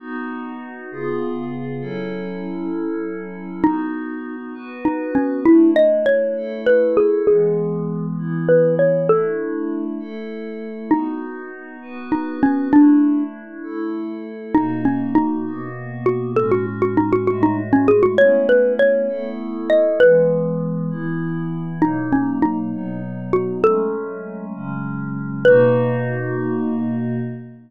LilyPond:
<<
  \new Staff \with { instrumentName = "Xylophone" } { \time 6/8 \key b \mixolydian \tempo 4. = 66 r2. | r2. | dis'4. r8 dis'8 cis'8 | e'8 dis''8 cis''4 b'8 gis'8 |
gis'4. r8 b'8 cis''8 | a'4. r4. | dis'4. r8 dis'8 cis'8 | d'4 r2 |
dis'8 cis'8 dis'4 r8 fis'8 | a'16 fis'16 r16 fis'16 dis'16 fis'16 fis'16 dis'16 r16 cis'16 gis'16 fis'16 | cis''8 b'8 cis''4 r8 dis''8 | b'2 r4 |
dis'8 cis'8 dis'4 r8 fis'8 | a'4. r4. | b'2. | }
  \new Staff \with { instrumentName = "Pad 5 (bowed)" } { \time 6/8 \key b \mixolydian <b dis' fis'>4. <cis b eis' gis'>4. | <fis cis' e' a'>2. | <b dis' fis'>4. <b fis' b'>4. | <a d' e'>4. <a e' a'>4. |
<e gis b>4. <e b e'>4. | <a d' e'>4. <a e' a'>4. | <b dis' fis'>4. <b fis' b'>4. | <a d' e'>4. <a e' a'>4. |
<b, ais dis' fis'>4. <b, ais b fis'>4. | <a, gis cis' fis'>4. <a, gis a fis'>4. | <a b cis' e'>4. <a b e' a'>4. | <e gis b>4. <e b e'>4. |
<b, fis ais dis'>4. <b, fis b dis'>4. | <fis gis a cis'>4. <cis fis gis cis'>4. | <b, ais dis' fis'>2. | }
>>